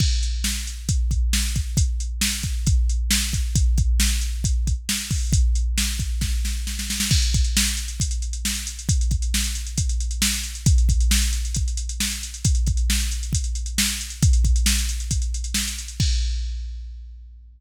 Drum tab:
CC |x---------------|----------------|----------------|----------------|
HH |--x---x-x-x---x-|x-x---x-x-x---x-|x-x---x-x-x---o-|x-x---x---------|
SD |----o-------o---|----o-------o---|----o-------o---|----o---o-o-oooo|
BD |o-------o-o---o-|o-----o-o-----o-|o-o-----o-o---o-|o-----o-o-------|

CC |x---------------|----------------|----------------|----------------|
HH |-xxx-xxxxxxx-xxx|xxxx-xxxxxxx-xxx|xxxx-xxxxxxx-xxx|xxxx-xxxxxxx-xxx|
SD |----o-------o---|----o-------o---|----o-------o---|----o-------o---|
BD |o-o-----o-------|o-o-----o-------|o-o-----o-------|o-o-----o-------|

CC |----------------|x---------------|
HH |xxxx-xxxxxxx-xxx|----------------|
SD |----o-------o---|----------------|
BD |o-o-----o-------|o---------------|